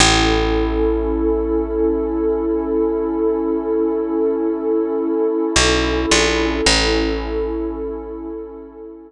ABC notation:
X:1
M:3/4
L:1/8
Q:1/4=54
K:Alyd
V:1 name="Pad 2 (warm)"
[CEA]6- | [CEA]6 | [CEA]6 |]
V:2 name="Electric Bass (finger)" clef=bass
A,,,6- | A,,,4 B,,, ^A,,, | A,,,6 |]